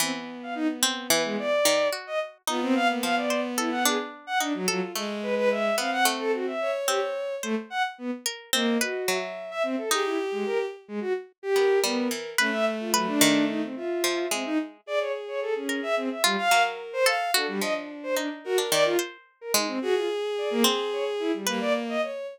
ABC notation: X:1
M:9/8
L:1/16
Q:3/8=73
K:none
V:1 name="Violin"
C z2 f ^D z3 B ^G, =d4 z ^d z2 | F C f ^A, f d2 z E ^f ^G z2 f D ^F, F, z | z2 B B e2 f ^f z A ^F e2 z G z3 | A, z ^f z B, z3 ^A,2 ^F3 z2 e C =A |
^G E z ^G, ^A z2 G, ^F z2 =G3 B,2 z2 | ^C e z F ^F, D3 ^D =C =F4 C D z2 | d ^c z c A ^C2 e =C e G, f2 z2 =c z2 | A G, ^d z2 c =D z ^F z =d =F z3 ^A ^D C |
^F =F z2 d ^A, z2 ^c z E G, G, d z ^d z2 |]
V:2 name="Violin"
B,12 z6 | B,12 z4 F2 | ^G,6 C6 ^c6 | z8 ^d4 e6 |
G6 z6 ^A6 | A,10 e6 z2 | ^G10 z2 ^A4 f2 | D8 ^A4 z6 |
^G12 ^A,4 ^c2 |]
V:3 name="Harpsichord"
E,6 C2 E,4 ^D,2 ^F4 | ^D4 F,2 c2 A2 =D4 ^D2 A2 | A,6 B,2 A,4 z2 C4 | c6 ^A2 C2 B2 ^F,6 |
^D12 B,2 G,2 E,2 | B4 B2 ^D,6 F,2 ^G,4 | z6 ^A4 F2 ^F,4 =A2 | ^F2 =F,4 ^D3 =D ^D,2 c4 ^G,2 |
z6 C6 B6 |]